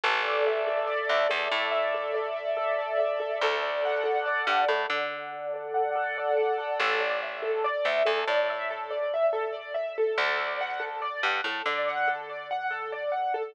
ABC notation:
X:1
M:4/4
L:1/8
Q:1/4=142
K:A
V:1 name="Acoustic Grand Piano"
A d e A d e A d | e A d e A d e A | A d f A d f A d | f A d f A d f A |
A d e A d e A d | e A d e A d e A | A d f A d f A d | f A d f A d f A |]
V:2 name="Electric Bass (finger)" clef=bass
A,,,5 D,, E,, A,,- | A,,8 | D,,5 =G,, A,, D,- | D,8 |
A,,,5 D,, E,, A,,- | A,,8 | D,,5 =G,, A,, D,- | D,8 |]